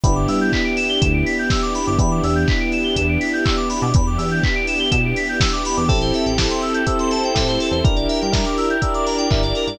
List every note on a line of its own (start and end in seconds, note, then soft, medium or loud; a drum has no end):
0.03 0.27 G1 loud
0.03 1.79 B3 loud
0.03 1.97 B3 medium
0.03 1.79 D4 medium
0.03 1.97 D4 medium
0.03 1.79 E4 medium
0.03 1.97 E4 medium
0.03 1.79 G4 medium
0.03 1.97 G4 loud
0.03 0.14 B5 loud
0.03 kick loud
0.03 closed hi-hat loud
0.15 0.26 D6 medium
0.28 0.50 G2 medium
0.28 0.39 E6 medium
0.28 open hi-hat loud
0.41 0.52 G6 loud
0.52 0.64 B6 loud
0.52 kick loud
0.52 clap loud
0.65 0.76 D7 medium
0.77 0.88 E7 loud
0.77 open hi-hat loud
0.89 1.00 G7 loud
1.01 1.24 D2 loud
1.01 1.12 E7 loud
1.01 kick loud
1.01 closed hi-hat loud
1.14 1.25 D7 medium
1.26 1.37 B6 loud
1.26 open hi-hat loud
1.39 1.50 G6 medium
1.50 1.61 E6 medium
1.50 kick loud
1.50 snare loud
1.62 1.73 D6 loud
1.75 1.86 B5 medium
1.75 open hi-hat loud
1.87 1.98 G1 medium
1.87 1.98 D6 medium
1.99 2.21 E2 loud
1.99 3.75 B3 medium
1.99 3.92 B3 medium
1.99 3.75 D4 medium
1.99 3.92 D4 loud
1.99 3.75 E4 medium
1.99 3.92 E4 medium
1.99 3.75 G4 medium
1.99 3.92 G4 medium
1.99 2.10 B5 loud
1.99 kick loud
1.99 closed hi-hat loud
2.11 2.22 D6 medium
2.23 2.45 E2 loud
2.23 2.35 E6 loud
2.23 open hi-hat loud
2.35 2.46 G6 medium
2.48 2.59 B6 loud
2.48 kick loud
2.48 clap loud
2.60 2.71 D7 medium
2.72 2.84 E7 medium
2.72 open hi-hat medium
2.84 2.95 G7 medium
2.96 3.18 E2 loud
2.96 3.08 E7 loud
2.96 kick medium
2.96 closed hi-hat loud
3.09 3.20 D7 medium
3.21 3.32 B6 medium
3.21 open hi-hat loud
3.33 3.44 G6 medium
3.45 3.56 E6 medium
3.45 kick loud
3.45 clap loud
3.57 3.68 D6 medium
3.69 3.80 B5 medium
3.69 open hi-hat loud
3.82 3.93 B2 loud
3.82 3.93 D6 medium
3.94 4.17 E2 loud
3.94 5.87 B3 medium
3.94 5.87 D4 medium
3.94 5.87 E4 medium
3.94 5.87 G4 loud
3.94 4.06 B5 loud
3.94 kick loud
3.94 closed hi-hat loud
4.07 4.18 D6 medium
4.18 4.40 E2 loud
4.18 4.29 E6 medium
4.18 open hi-hat loud
4.31 4.42 G6 medium
4.43 4.55 B6 loud
4.43 kick loud
4.43 clap loud
4.55 4.66 D7 medium
4.67 4.79 E7 medium
4.67 open hi-hat loud
4.79 4.90 G7 loud
4.91 5.14 B2 loud
4.91 5.02 E7 loud
4.91 kick loud
4.91 closed hi-hat loud
5.05 5.16 D7 medium
5.16 5.28 B6 medium
5.16 open hi-hat loud
5.29 5.40 G6 medium
5.40 5.51 E6 medium
5.40 kick loud
5.40 snare loud
5.53 5.64 D6 medium
5.65 5.77 B5 loud
5.65 open hi-hat loud
5.77 5.89 E2 medium
5.77 5.88 D6 loud
5.88 6.12 A1 loud
5.88 6.33 C4 loud
5.88 6.86 C4 medium
5.88 6.33 E4 medium
5.88 6.86 E4 loud
5.88 6.33 G4 medium
5.88 6.86 G4 loud
5.88 5.99 A4 loud
5.88 6.33 A4 loud
5.88 6.86 A4 loud
5.88 kick loud
5.88 crash loud
6.01 6.13 C5 medium
6.01 closed hi-hat medium
6.14 6.25 E5 medium
6.14 open hi-hat loud
6.26 6.48 A1 medium
6.26 6.37 G5 medium
6.26 closed hi-hat medium
6.38 6.82 C4 medium
6.38 6.82 E4 medium
6.38 6.82 G4 medium
6.38 6.82 A4 medium
6.38 6.49 A5 medium
6.38 kick medium
6.38 snare loud
6.50 6.61 C6 medium
6.50 closed hi-hat medium
6.62 6.73 E6 medium
6.62 open hi-hat medium
6.74 6.85 G6 medium
6.74 closed hi-hat loud
6.86 7.30 C4 medium
6.86 7.84 C4 loud
6.86 7.30 E4 medium
6.86 7.84 E4 loud
6.86 7.30 G4 medium
6.86 7.30 A4 medium
6.86 7.84 A4 loud
6.86 7.84 C5 medium
6.86 6.98 E6 loud
6.86 kick medium
6.86 closed hi-hat loud
6.99 7.11 C6 medium
6.99 closed hi-hat medium
7.11 7.23 A5 medium
7.11 open hi-hat loud
7.23 7.35 G5 medium
7.23 closed hi-hat medium
7.35 7.58 A2 medium
7.35 7.79 C4 medium
7.35 7.79 E4 medium
7.35 7.79 G4 medium
7.35 7.79 A4 medium
7.35 7.46 E5 loud
7.35 kick loud
7.35 snare loud
7.48 7.59 C5 medium
7.48 closed hi-hat medium
7.60 7.71 A4 medium
7.60 open hi-hat loud
7.71 7.82 E2 medium
7.71 7.83 C5 medium
7.71 closed hi-hat medium
7.84 8.07 G1 medium
7.84 8.28 D4 medium
7.84 8.81 D4 medium
7.84 8.28 E4 medium
7.84 8.81 E4 medium
7.84 8.28 G4 medium
7.84 8.81 G4 loud
7.84 7.95 A#4 loud
7.84 8.28 A#4 medium
7.84 8.81 A#4 medium
7.84 kick loud
7.84 closed hi-hat loud
7.96 8.07 D5 medium
7.96 closed hi-hat medium
8.09 8.20 E5 medium
8.09 open hi-hat loud
8.21 8.44 G2 medium
8.21 8.33 G5 medium
8.21 closed hi-hat medium
8.32 8.76 D4 medium
8.32 8.76 E4 medium
8.32 8.76 G4 medium
8.32 8.76 A#4 medium
8.32 8.44 A#5 medium
8.32 kick loud
8.32 snare loud
8.45 8.56 D6 medium
8.45 closed hi-hat medium
8.58 8.68 E6 medium
8.58 open hi-hat medium
8.70 8.81 G6 medium
8.70 closed hi-hat medium
8.82 9.26 D4 medium
8.82 9.78 D4 loud
8.82 9.26 E4 medium
8.82 9.78 E4 medium
8.82 9.26 G4 medium
8.82 9.26 A#4 medium
8.82 9.78 A#4 medium
8.82 9.78 D5 loud
8.82 8.92 E6 loud
8.82 kick loud
8.82 closed hi-hat loud
8.94 9.05 D6 loud
8.94 closed hi-hat medium
9.06 9.17 A#5 medium
9.06 open hi-hat loud
9.18 9.29 G5 medium
9.18 closed hi-hat medium
9.30 9.53 G1 medium
9.30 9.75 D4 medium
9.30 9.75 E4 medium
9.30 9.75 G4 medium
9.30 9.75 A#4 medium
9.30 9.41 E5 medium
9.30 kick loud
9.30 clap loud
9.43 9.54 D5 medium
9.43 closed hi-hat medium
9.55 9.67 A#4 medium
9.55 open hi-hat medium
9.67 9.78 G2 medium
9.67 9.78 D5 medium
9.67 closed hi-hat loud